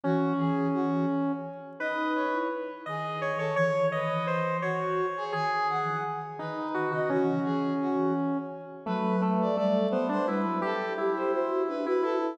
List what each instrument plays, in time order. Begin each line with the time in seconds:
0.03 flute E3, lead 1 (square) C#4, brass section F#4
0.38 flute E3, brass section G#4
0.74 brass section F#4
1.79 flute D#4, lead 1 (square) B4, brass section D#5
2.15 brass section C#5
2.33 flute E4
2.86 flute D#3, brass section G#4, lead 1 (square) D#5
3.21 lead 1 (square) C#5
3.38 flute D#3, brass section A4, lead 1 (square) C#5
3.56 flute E3, lead 1 (square) C#5, brass section C#5
3.92 flute D#3, brass section B4, lead 1 (square) D#5
4.10 flute E3
4.27 lead 1 (square) C5
4.61 brass section F#4, lead 1 (square) C#5
5.17 brass section G#4
5.32 flute D#3, lead 1 (square) G#4, brass section G#5
5.70 brass section F#5
5.85 flute E3
6.39 flute D#3, lead 1 (square) D#4, brass section B4
6.74 lead 1 (square) F#4
6.91 flute C#3, lead 1 (square) F#4, brass section D#5
7.09 flute E3, lead 1 (square) C#4, brass section F#4
7.45 flute E3, brass section G#4
7.81 brass section F#4
8.86 flute F#3, lead 1 (square) A3, brass section B4
9.22 lead 1 (square) A3
9.41 brass section D5
9.56 flute G3, lead 1 (square) A3, brass section D5
9.90 lead 1 (square) B3, brass section C5
10.09 lead 1 (square) D4, brass section C5
10.27 flute G3, lead 1 (square) E4, brass section B4
10.45 flute F#3
10.62 lead 1 (square) G4, flute G4, brass section A4
10.98 lead 1 (square) E4, flute G4
11.16 brass section C5
11.32 flute F#4, brass section C5
11.68 flute D4, brass section B4
11.86 lead 1 (square) E4, flute F#4, brass section B4
12.02 lead 1 (square) E4, brass section A4
12.21 flute E4